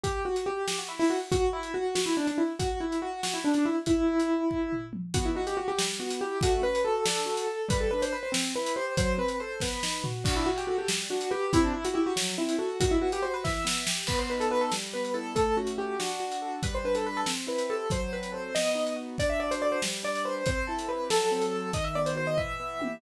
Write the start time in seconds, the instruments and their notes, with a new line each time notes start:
0.03 acoustic grand piano G4, kick, closed hi-hat
0.25 acoustic grand piano F#4
0.36 closed hi-hat
0.46 acoustic grand piano G4
0.68 acoustic grand piano G4, snare
0.79 acoustic grand piano F#4
0.88 acoustic grand piano E4
0.99 acoustic grand piano E4, open hi-hat
1.10 acoustic grand piano F#4
1.32 acoustic grand piano F#4, kick, closed hi-hat
1.53 acoustic grand piano E4
1.63 closed hi-hat
1.74 acoustic grand piano F#4
1.95 acoustic grand piano F#4, snare
2.06 acoustic grand piano E4
2.17 acoustic grand piano D4
2.27 acoustic grand piano D4, closed hi-hat
2.38 acoustic grand piano E4
2.59 acoustic grand piano F#4, kick, closed hi-hat
2.80 acoustic grand piano E4
2.92 closed hi-hat
3.02 acoustic grand piano F#4
3.23 acoustic grand piano F#4, snare
3.34 acoustic grand piano E4
3.44 acoustic grand piano D4
3.54 acoustic grand piano D4, closed hi-hat
3.66 acoustic grand piano E4
3.86 acoustic grand piano E4, kick, closed hi-hat
4.20 closed hi-hat
4.51 kick
4.72 floor tom
4.93 mid tom
5.14 acoustic grand piano B3 F#4, kick, closed hi-hat
5.25 acoustic grand piano E4
5.35 acoustic grand piano D#4 F#4
5.47 acoustic grand piano G4, closed hi-hat
5.57 acoustic grand piano F#4
5.68 acoustic grand piano G4
5.78 acoustic grand piano G3, snare
5.99 acoustic grand piano B3 F#4
6.10 closed hi-hat
6.21 acoustic grand piano E4 G4
6.41 acoustic grand piano A3 F#4, kick, closed hi-hat
6.62 acoustic grand piano C#4 B4
6.75 closed hi-hat
6.84 acoustic grand piano F#4 A4
7.05 acoustic grand piano D4 A4, snare
7.26 acoustic grand piano F#4
7.37 closed hi-hat
7.47 acoustic grand piano A4
7.68 acoustic grand piano G3 B4, kick, closed hi-hat
7.80 acoustic grand piano A4
7.91 acoustic grand piano D4 B4
8.02 acoustic grand piano C5, closed hi-hat
8.12 acoustic grand piano B4
8.23 acoustic grand piano C5
8.32 acoustic grand piano C4, snare
8.55 acoustic grand piano E4 B4
8.66 closed hi-hat
8.76 acoustic grand piano G4 C5
8.97 acoustic grand piano F#3 C5, kick, closed hi-hat
9.18 acoustic grand piano C4 B4
9.28 closed hi-hat
9.40 acoustic grand piano A4 C5
9.60 acoustic grand piano B3 B4, kick, snare
9.83 acoustic grand piano D#4, snare
10.04 acoustic grand piano F#4, floor tom
10.24 acoustic grand piano D4 F#4, kick, crash
10.36 acoustic grand piano E4
10.46 acoustic grand piano F#4
10.57 acoustic grand piano G4, closed hi-hat
10.67 acoustic grand piano F#4 A4
10.78 acoustic grand piano G4
10.88 acoustic grand piano G3, snare
11.10 acoustic grand piano D4 F#4
11.21 closed hi-hat
11.30 acoustic grand piano G4 B4
11.53 acoustic grand piano C4 E4, kick, closed hi-hat
11.64 acoustic grand piano D4
11.73 acoustic grand piano E4
11.85 acoustic grand piano F#4, closed hi-hat
11.94 acoustic grand piano E4 G4
12.06 acoustic grand piano F#4
12.16 acoustic grand piano F#3, snare
12.38 acoustic grand piano C4 E4
12.49 closed hi-hat
12.58 acoustic grand piano F#4 A4
12.80 acoustic grand piano D#3 F#4, kick, closed hi-hat
12.91 acoustic grand piano E4
13.02 acoustic grand piano B3 F#4
13.12 acoustic grand piano G4, closed hi-hat
13.22 acoustic grand piano F#4 C5
13.34 acoustic grand piano B4
13.44 acoustic grand piano E3 E5, kick, snare
13.65 acoustic grand piano B3, snare
13.87 acoustic grand piano G4, snare
14.07 acoustic grand piano B3 B4, kick, crash
14.19 acoustic grand piano C5
14.30 acoustic grand piano D#4 B4
14.40 acoustic grand piano A4, closed hi-hat
14.50 acoustic grand piano F#4 B4
14.61 acoustic grand piano A4
14.72 acoustic grand piano G3, snare
14.93 acoustic grand piano B3 B4
15.05 closed hi-hat
15.14 acoustic grand piano E4 A4
15.35 acoustic grand piano A3 A4, kick, closed hi-hat
15.57 acoustic grand piano C#4 F#4
15.67 closed hi-hat
15.78 acoustic grand piano F#4 G4
15.99 acoustic grand piano D4 F#4, snare
16.20 acoustic grand piano F#4
16.32 closed hi-hat
16.42 acoustic grand piano A4
16.63 acoustic grand piano G3 B4, kick, closed hi-hat
16.75 acoustic grand piano C5
16.84 acoustic grand piano D4 B4
16.95 acoustic grand piano A4, closed hi-hat
17.06 acoustic grand piano B4
17.17 acoustic grand piano A4
17.26 acoustic grand piano C4, snare
17.47 acoustic grand piano E4 B4
17.58 closed hi-hat
17.70 acoustic grand piano G4 A4
17.90 acoustic grand piano F#3 C5, kick, closed hi-hat
18.13 acoustic grand piano C4 B4
18.23 closed hi-hat
18.32 acoustic grand piano A4 C5
18.55 acoustic grand piano B3 D#5, snare
18.75 acoustic grand piano D#4
18.87 closed hi-hat
18.96 acoustic grand piano F#4
19.18 acoustic grand piano D4 D5, kick, closed hi-hat
19.30 acoustic grand piano E5
19.39 acoustic grand piano F#4 D5
19.51 acoustic grand piano C5, closed hi-hat
19.62 acoustic grand piano A4 D5
19.72 acoustic grand piano C5
19.82 acoustic grand piano G3, snare
20.03 acoustic grand piano D4 D5
20.15 closed hi-hat
20.25 acoustic grand piano B4 C5
20.46 acoustic grand piano C4 C5, kick, closed hi-hat
20.67 acoustic grand piano E4 A4
20.79 closed hi-hat
20.89 acoustic grand piano G4 B4
21.10 acoustic grand piano F#3 A4, snare
21.31 acoustic grand piano C4
21.42 closed hi-hat
21.54 acoustic grand piano A4
21.73 acoustic grand piano D#3 D#5, kick, closed hi-hat
21.84 acoustic grand piano E5
21.95 acoustic grand piano B3 D5
22.06 acoustic grand piano C5, closed hi-hat
22.16 acoustic grand piano F#4 C5
22.27 acoustic grand piano D#5
22.37 acoustic grand piano E3 E5, kick, floor tom
22.60 acoustic grand piano B3
22.79 acoustic grand piano G4, high tom